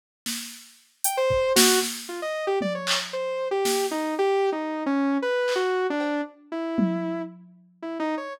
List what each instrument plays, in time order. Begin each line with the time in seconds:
0.26 snare
1.04 lead 2 (sawtooth) G5, closed hi-hat
1.17 lead 2 (sawtooth) C5
1.30 kick
1.56 lead 2 (sawtooth) F#4, snare
1.83 snare
2.09 lead 2 (sawtooth) F4
2.22 lead 2 (sawtooth) D#5
2.47 lead 2 (sawtooth) G4
2.61 lead 2 (sawtooth) D5, high tom
2.75 lead 2 (sawtooth) C#5
2.87 clap
3.13 lead 2 (sawtooth) C5
3.51 lead 2 (sawtooth) G4
3.65 snare
3.91 lead 2 (sawtooth) D#4
4.19 lead 2 (sawtooth) G4
4.52 lead 2 (sawtooth) D#4
4.86 lead 2 (sawtooth) C#4
5.22 lead 2 (sawtooth) B4
5.48 clap
5.56 lead 2 (sawtooth) F#4
5.90 lead 2 (sawtooth) D4
6.00 cowbell
6.52 lead 2 (sawtooth) E4
6.78 high tom
7.82 lead 2 (sawtooth) E4
8.00 lead 2 (sawtooth) D#4
8.17 lead 2 (sawtooth) C#5